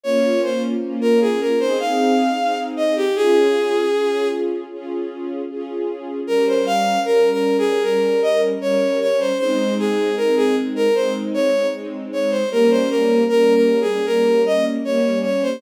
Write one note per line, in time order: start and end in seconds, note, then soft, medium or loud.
0.04 0.74 A#3 medium
0.04 0.74 C#4 loud
0.04 0.74 F4 loud
0.04 0.41 C#5 loud
0.43 0.62 C5 medium
0.82 1.52 A#3 medium
0.82 1.52 C#4 medium
0.82 1.52 F4 medium
1.01 1.20 A#4 loud
1.21 1.40 G#4 medium
1.40 1.59 A#4 medium
1.60 2.30 C4 loud
1.60 2.30 D#4 loud
1.60 2.30 G#4 loud
1.60 1.78 C5 loud
1.80 2.58 F5 medium
2.38 3.08 C4 medium
2.38 3.08 D#4 medium
2.38 3.08 G#4 medium
2.77 2.95 D#5 medium
2.96 3.15 G4 loud
3.16 3.86 C#4 loud
3.16 3.86 F4 loud
3.16 4.28 G#4 loud
3.16 3.86 G#4 loud
3.94 4.64 C#4 medium
3.94 4.64 F4 medium
3.94 4.64 G#4 medium
4.72 5.42 C#4 medium
4.72 5.42 F4 medium
4.72 5.42 G#4 medium
5.50 6.20 C#4 medium
5.50 6.20 F4 medium
5.50 6.20 G#4 medium
6.27 6.98 G3 loud
6.27 6.98 C#4 loud
6.27 6.46 A#4 loud
6.27 6.98 A#4 medium
6.47 6.66 C5 medium
6.66 7.00 F5 loud
7.05 7.75 G3 medium
7.05 7.75 C#4 medium
7.05 7.30 A#4 loud
7.05 7.75 A#4 medium
7.32 7.57 A#4 loud
7.58 7.83 G#4 loud
7.83 8.54 G3 medium
7.83 8.54 C#4 medium
7.83 8.21 A#4 loud
7.83 8.54 A#4 medium
8.22 8.41 D#5 loud
8.61 9.31 G3 medium
8.61 9.31 C#4 medium
8.61 9.31 A#4 medium
8.61 8.99 C#5 loud
9.01 9.19 C#5 loud
9.20 9.38 C5 loud
9.38 10.09 G#3 loud
9.38 10.09 C4 loud
9.38 10.09 D#4 loud
9.38 9.74 C5 loud
9.79 10.15 G#4 loud
10.17 10.87 G#3 medium
10.17 10.87 C4 medium
10.17 10.87 D#4 medium
10.17 10.35 A#4 loud
10.37 10.55 G#4 loud
10.76 10.94 A#4 loud
10.95 11.65 G#3 medium
10.95 11.65 C4 medium
10.95 11.65 D#4 medium
10.95 11.13 C5 loud
11.34 11.67 C#5 loud
11.73 12.43 G#3 medium
11.73 12.43 C4 medium
11.73 12.43 D#4 medium
12.13 12.31 C#5 medium
12.31 12.49 C5 medium
12.51 13.21 G3 loud
12.51 13.21 A#3 loud
12.51 13.21 C#4 loud
12.51 12.70 A#4 loud
12.71 12.89 C5 loud
12.90 13.24 A#4 loud
13.29 13.99 G3 medium
13.29 13.99 A#3 medium
13.29 13.99 C#4 medium
13.29 13.53 A#4 loud
13.55 13.80 A#4 medium
13.81 14.06 G#4 medium
14.06 14.77 G3 medium
14.06 14.77 A#3 medium
14.06 14.77 C#4 medium
14.06 14.42 A#4 loud
14.46 14.65 D#5 loud
14.85 15.55 G3 medium
14.85 15.55 A#3 medium
14.85 15.55 C#4 medium
14.85 15.19 C#5 medium
15.24 15.42 C#5 medium
15.42 15.61 C5 loud